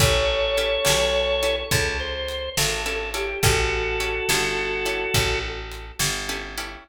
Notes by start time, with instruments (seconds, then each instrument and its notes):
0.00 electric bass (finger) A1, acoustic guitar (steel) C#4 E4 G4 A4, drawbar organ A4 C#5, kick, closed hi-hat
0.57 acoustic guitar (steel) C#4 E4 G4 A4, closed hi-hat
0.85 electric bass (finger) B1, acoustic guitar (steel) C#4 E4 G4 A4, snare
1.43 acoustic guitar (steel) C#4 E4 G4 A4, closed hi-hat
1.71 electric bass (finger) C#2, acoustic guitar (steel) C#4 E4 G4 A4, drawbar organ A4, kick, closed hi-hat
2.00 drawbar organ C5
2.28 closed hi-hat
2.57 electric bass (finger) G#1, drawbar organ A4, snare
2.86 acoustic guitar (steel) C#4 E4 G4 A4, drawbar organ A4
3.14 acoustic guitar (steel) C#4 E4 G4 A4, drawbar organ G4, closed hi-hat
3.43 electric bass (finger) A1, acoustic guitar (steel) C#4 E4 G4 A4, drawbar organ F#4 A4, kick, closed hi-hat
4.00 acoustic guitar (steel) C#4 E4 G4 A4, closed hi-hat
4.29 electric bass (finger) G1, acoustic guitar (steel) C#4 E4 G4 A4, snare
4.85 acoustic guitar (steel) C#4 E4 G4 A4, closed hi-hat
5.14 electric bass (finger) A1, acoustic guitar (steel) C#4 E4 G4 A4, kick, closed hi-hat
5.72 closed hi-hat
5.99 electric bass (finger) G1, snare
6.29 acoustic guitar (steel) C#4 E4 G4 A4
6.58 acoustic guitar (steel) C#4 E4 G4 A4, closed hi-hat